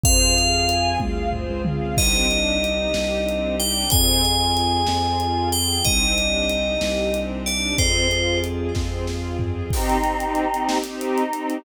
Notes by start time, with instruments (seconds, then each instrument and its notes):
0.03 synth bass 2 F2, string ensemble 1 C4 F4 G#4 C5, tubular bells F5, kick, closed hi-hat
0.36 string ensemble 1 F5, closed hi-hat
0.69 string ensemble 1 G#5, closed hi-hat
1.00 synth bass 2 D2, string ensemble 1 F5, kick, high tom
1.33 string ensemble 1 C5, floor tom
1.49 synth bass 2 C#2
1.65 string ensemble 1 F5, mid tom
1.97 synth bass 2 C2, string ensemble 1 C4 D4 D#4 G4, tubular bells D#5, kick, crash
2.30 string ensemble 1 D4, closed hi-hat
2.62 string ensemble 1 D#4, closed hi-hat
2.94 synth bass 2 C2, string ensemble 1 G4, snare
3.27 string ensemble 1 C4, closed hi-hat
3.60 string ensemble 1 D4, tubular bells G5, closed hi-hat
3.90 synth bass 2 F2, string ensemble 1 C4 F4 G#4, tubular bells G#5, kick, closed hi-hat
4.24 string ensemble 1 F4, closed hi-hat
4.57 string ensemble 1 G#4, closed hi-hat
4.87 synth bass 2 F2, string ensemble 1 C4, snare
5.20 string ensemble 1 F4, closed hi-hat
5.51 string ensemble 1 G#4, tubular bells G5, closed hi-hat
5.84 synth bass 2 C2, string ensemble 1 C4 D4 D#4 G4, tubular bells D#5, kick, closed hi-hat
6.17 string ensemble 1 D4, closed hi-hat
6.49 string ensemble 1 D#4, closed hi-hat
6.81 synth bass 2 C2, string ensemble 1 G4, snare
7.13 string ensemble 1 C4, closed hi-hat
7.46 string ensemble 1 D4, tubular bells D5, closed hi-hat
7.78 synth bass 2 F2, string ensemble 1 C4 F4 G#4, tubular bells C5, kick, closed hi-hat
8.11 string ensemble 1 F4, closed hi-hat
8.44 string ensemble 1 G#4, closed hi-hat
8.75 synth bass 2 F2, string ensemble 1 C4, kick, snare
9.07 string ensemble 1 F4, snare
9.39 string ensemble 1 G#4, floor tom
9.70 string ensemble 1 C4 D#4 G4, choir aahs C4 D#4, kick, crash
9.89 closed hi-hat
10.03 string ensemble 1 C4 D#4 G4, closed hi-hat
10.19 string ensemble 1 C4 D#4 G4, closed hi-hat
10.35 closed hi-hat
10.53 string ensemble 1 C4 D#4 G4, closed hi-hat
10.69 snare
10.84 string ensemble 1 C4 D#4 G4, closed hi-hat
11.01 choir aahs D#4, closed hi-hat
11.18 closed hi-hat
11.32 string ensemble 1 C4 D#4 G4, closed hi-hat
11.50 closed hi-hat